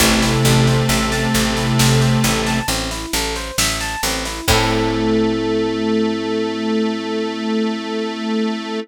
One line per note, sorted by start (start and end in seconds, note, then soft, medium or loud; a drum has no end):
0.00 0.37 A1 loud
0.00 2.59 C3 loud
0.00 2.59 A3 loud
0.00 0.20 C4 loud
0.00 kick medium
0.00 snare medium
0.00 crash medium
0.22 0.43 E4 medium
0.22 snare medium
0.45 0.83 A1 medium
0.45 0.65 A4 medium
0.45 snare medium
0.67 0.87 C5 medium
0.67 snare medium
0.89 1.27 A1 medium
0.89 1.10 E5 medium
0.89 snare medium
1.12 1.32 A5 medium
1.12 snare medium
1.34 1.73 A1 medium
1.34 1.54 C4 medium
1.34 snare medium
1.57 1.77 E4 medium
1.57 snare medium
1.79 2.18 A1 medium
1.79 1.99 A4 medium
1.79 snare loud
2.01 2.21 C5 medium
2.01 snare medium
2.24 2.62 A1 medium
2.24 2.44 E5 medium
2.24 snare medium
2.46 2.66 A5 medium
2.46 snare medium
2.68 3.06 A1 medium
2.68 2.89 C4 medium
2.68 snare medium
2.91 3.11 E4 medium
2.91 snare medium
3.13 3.51 A1 medium
3.13 3.34 A4 medium
3.13 snare medium
3.36 3.56 C5 medium
3.36 snare medium
3.58 3.96 A1 medium
3.58 3.79 E5 medium
3.58 snare loud
3.81 4.01 A5 medium
3.81 snare medium
4.03 4.41 A1 medium
4.03 4.23 C4 medium
4.03 snare medium
4.25 4.46 E4 medium
4.25 snare medium
4.48 8.79 A2 loud
4.48 8.80 A3 loud
4.48 8.79 C4 medium
4.48 8.79 E4 loud
4.48 kick loud
4.48 crash loud
4.52 8.79 A4 loud